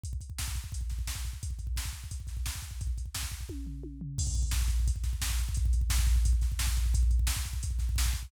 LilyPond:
\new DrumStaff \drummode { \time 4/4 \tempo 4 = 174 <hh bd>16 bd16 <hh bd>16 bd16 <bd sn>16 bd16 <hh bd>16 bd16 <hh bd>16 bd16 <hh bd sn>16 bd16 <bd sn>16 bd16 <hh bd>16 bd16 | <hh bd>16 bd16 <hh bd>16 bd16 <bd sn>16 bd16 <hh bd>16 bd16 <hh bd>16 bd16 <hh bd sn>16 bd16 <bd sn>16 bd16 <hh bd>16 bd16 | <hh bd>16 bd16 <hh bd>16 bd16 <bd sn>16 bd16 <hh bd>16 bd16 <bd tommh>8 tomfh8 tommh8 tomfh8 | <cymc bd>16 bd16 <hh bd>16 bd16 <bd sn>16 bd16 <hh bd>16 bd16 <hh bd>16 bd16 <hh bd sn>16 bd16 <bd sn>16 bd16 <hh bd>16 bd16 |
<hh bd>16 bd16 <hh bd>16 bd16 <bd sn>16 bd16 <hh bd>16 bd16 <hh bd>16 bd16 <hh bd sn>16 bd16 <bd sn>16 bd16 <hh bd>16 bd16 | <hh bd>16 bd16 <hh bd>16 bd16 <bd sn>16 bd16 <hh bd>16 bd16 <hh bd>16 bd16 <hh bd sn>16 bd16 <bd sn>16 bd16 <hh bd>16 bd16 | }